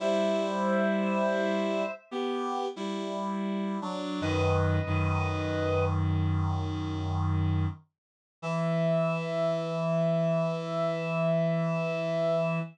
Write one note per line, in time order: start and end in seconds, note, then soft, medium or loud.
0.00 1.82 G3 medium
0.00 1.82 E4 loud
0.00 1.92 C5 medium
0.00 1.92 E5 medium
2.11 2.66 B3 medium
2.11 2.66 G4 medium
2.76 3.77 G3 medium
2.76 3.77 E4 medium
3.82 4.20 F#3 medium
3.82 4.20 D4 medium
4.21 4.78 F#2 loud
4.21 4.78 D#3 loud
4.21 5.85 B4 medium
4.21 5.85 D#5 medium
4.86 7.66 F#2 medium
4.86 7.66 D#3 medium
8.42 12.59 E3 loud
8.42 12.59 E5 loud